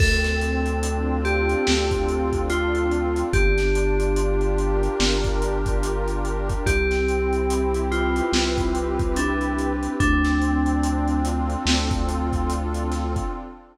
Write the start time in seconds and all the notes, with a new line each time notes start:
0.00 D2 C4 A4, kick, crash
0.24 snare, closed hi-hat
0.41 D4, closed hi-hat
0.66 closed hi-hat
0.83 F4, closed hi-hat
1.25 G4 A4, closed hi-hat
1.49 closed hi-hat
1.67 D2 F4, snare
1.91 kick, closed hi-hat
2.09 D4, closed hi-hat
2.33 kick, closed hi-hat
2.49 C4 F4, closed hi-hat
2.75 closed hi-hat
2.91 D4, closed hi-hat
3.16 closed hi-hat
3.33 G1 D4 G4, kick, closed hi-hat
3.58 snare, closed hi-hat
3.74 F4, closed hi-hat
4.00 closed hi-hat
4.16 G4, closed hi-hat
4.41 closed hi-hat
4.58 A#4, closed hi-hat
4.83 closed hi-hat
5.00 G1 G4, snare
5.24 kick, snare, closed hi-hat
5.42 F4, closed hi-hat
5.66 kick, closed hi-hat
5.83 D4, closed hi-hat
6.08 closed hi-hat
6.25 F4, closed hi-hat
6.49 kick, closed hi-hat
6.66 C2 C4 G4, kick, closed hi-hat
6.91 snare, closed hi-hat
7.07 E4, closed hi-hat
7.33 closed hi-hat
7.49 G4, closed hi-hat
7.74 closed hi-hat
7.91 F4 B4, closed hi-hat
8.16 closed hi-hat
8.32 C2 G4, snare
8.58 kick, closed hi-hat
8.75 E4, closed hi-hat
8.99 kick, closed hi-hat
9.16 C4 D4, closed hi-hat
9.41 closed hi-hat
9.59 E4, closed hi-hat
9.83 closed hi-hat
9.99 D2 C4 D4, kick, closed hi-hat
10.24 snare, closed hi-hat
10.42 D4, closed hi-hat
10.66 closed hi-hat
10.84 F4, closed hi-hat
11.08 closed hi-hat
11.25 A4, closed hi-hat
11.50 closed hi-hat
11.65 D2 F4, snare
11.91 kick, closed hi-hat
12.08 D4, closed hi-hat
12.33 kick, closed hi-hat
12.50 C4, closed hi-hat
12.74 closed hi-hat
12.92 D4, snare, closed hi-hat
13.16 kick, closed hi-hat